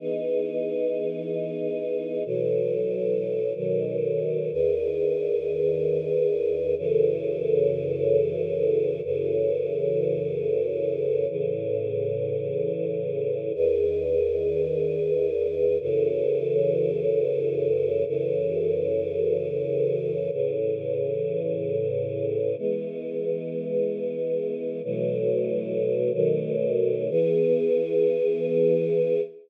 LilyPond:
\new Staff { \time 7/8 \key e \major \tempo 4 = 93 <e b dis' gis'>2.~ <e b dis' gis'>8 | <b, e fis a'>2 <b, dis fis a'>4. | <e, dis gis' b'>2.~ <e, dis gis' b'>8 | <fis, cis e a'>2.~ <fis, cis e a'>8 |
<fis, cis e a'>2.~ <fis, cis e a'>8 | <a, cis e>2.~ <a, cis e>8 | <e, dis gis' b'>2.~ <e, dis gis' b'>8 | <fis, cis e a'>2.~ <fis, cis e a'>8 |
<fis, cis e a'>2.~ <fis, cis e a'>8 | <a, cis e>2.~ <a, cis e>8 | <e gis b>2.~ <e gis b>8 | <b, e fis a>2 <b, dis fis a>4. |
<e b gis'>2.~ <e b gis'>8 | }